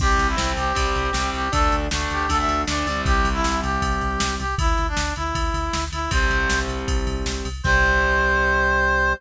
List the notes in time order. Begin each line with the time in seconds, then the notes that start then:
0.00 C2 G3 C4 G4, kick, crash
0.18 C2, ride
0.28 E4
0.37 C2 G3 C4, snare
0.57 C2 G4, ride
0.75 C2 G3 C4, kick, ride
0.95 C2, ride
1.13 C2 G3 C4, snare
1.33 C2 G4, ride
1.52 D2 A3 D4 A4, kick, ride
1.72 D2, ride
1.91 D2 A3 D4, snare
2.10 D2 G4, ride
2.28 D2 A3 D4 A4, kick, ride
2.38 E5
2.48 D2, ride
2.67 D2 A3 D4 D5, snare
2.86 D2 G3 C4, ride
3.05 C2 G4, kick, ride
3.25 C2, ride
3.33 E4
3.44 C2, snare
3.63 C2 G4, ride
3.82 C2, kick, ride
4.01 C2, ride
4.20 C2, snare
4.39 C2 G4, ride
4.58 D2 E4, kick, ride
4.78 D2, ride
4.88 D4
4.97 D2, snare
5.16 D2 E4, ride
5.35 D2, kick, ride
5.54 D2, ride
5.73 D2, snare
5.92 D2 E4, ride
6.11 C2 G3 C4 C5, kick, ride
6.30 C2, ride
6.50 C2, snare
6.68 C2, ride
6.88 C2, kick, ride
7.07 C2, ride
7.26 C2, snare
7.45 C2, ride
7.63 C2 G3 C4 C5, kick, crash